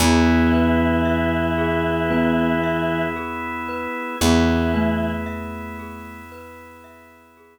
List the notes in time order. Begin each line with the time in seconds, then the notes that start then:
0.00 E2 E3 B3 E4 G#4
0.53 B4
1.05 E5
1.58 G#4
2.10 B3 B4
2.64 E5
3.16 G#4
3.68 B4
4.21 E2 E3 B3 E4 G#4
4.74 A3 B4
5.26 E5
5.79 G#4
6.32 B4
6.84 E5
7.37 G#4